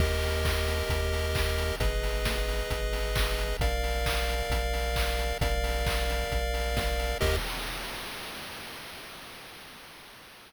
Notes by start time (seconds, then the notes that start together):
0.00 D#2 G4 A#4 D#5, kick, crash
0.23 open hi-hat
0.45 kick, clap
0.68 open hi-hat
0.89 D#2, kick, closed hi-hat
1.13 open hi-hat
1.35 kick, clap
1.58 open hi-hat
1.80 G#1 G#4 B4 D#5, kick, closed hi-hat
2.03 open hi-hat
2.25 kick, snare
2.48 open hi-hat
2.70 G#1, kick, closed hi-hat
2.93 open hi-hat
3.16 kick, clap
3.38 open hi-hat
3.60 A#1 A#4 D5 F5, kick, closed hi-hat
3.84 open hi-hat
4.06 kick, clap
4.29 open hi-hat
4.50 A#1, kick, closed hi-hat
4.73 open hi-hat
4.96 kick, clap
5.19 open hi-hat
5.41 A#1 A#4 D5 F5, kick, closed hi-hat
5.64 open hi-hat
5.86 kick, clap
6.09 open hi-hat
6.32 A#1, kick, closed hi-hat
6.54 open hi-hat
6.77 kick, snare
6.99 open hi-hat
7.21 D#2 G4 A#4 D#5, kick, crash